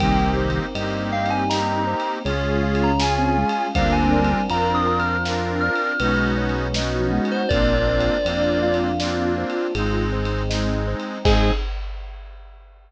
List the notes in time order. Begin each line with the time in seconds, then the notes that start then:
0.00 C2 D#3 G3 A#3 C4 D#4 G4 A#4 G5, kick, ride
0.37 C5
0.50 ride
0.75 G2 A#3 C4 D#4 G4 D#5, ride
1.12 F5 G5
1.26 ride
1.30 G#5
1.49 A#3 C4 D#4 G4 D#5 A#5, snare
1.87 C5
2.00 ride
2.24 C#2 G#3 C#4 F4 G#4 C#5, ride
2.63 F5
2.75 ride
2.83 A#5
3.00 C#4 F4 G#4 G#5, snare
3.18 C4
3.37 G#3 F5
3.49 ride
3.73 D2 G3 A#3 C4 D4 F4 A#4 C5 F5, kick, ride
3.92 G#5
4.12 D5
4.25 ride
4.49 F2 C4 D4 F4 A#4 F5 A#5, ride
4.75 D#6
4.87 A#5
4.99 F6, ride
5.25 C4 D4 F4 A#4 F5, snare
5.60 D5 F6
5.76 ride
6.00 B1 G#3 B3 C#4 D#4 F#4 B4, ride
6.38 C#5
6.49 ride
6.74 B3 C#4 D#4 F#4 D#5, snare
6.94 F3
7.12 G#3 F#5
7.25 ride
7.31 C5
7.49 A#1 A#3 C4 D4 F4 A#4 D5, kick, ride
7.87 C5
8.00 ride
8.24 F2 A#3 C4 D4 F4 D5, ride
8.62 F4 F5
8.74 ride
8.99 A#3 C4 D4 F4 D5, snare
9.38 C5
9.50 ride
9.75 G#1 G#3 C4 D#4 G#4, ride
10.12 C5
10.25 ride
10.50 G#3 C4 D#4 D#5, snare
10.88 C5
11.00 ride
11.25 G#2 C4 D#4 G#4 C5 D#5 G#5, kick, crash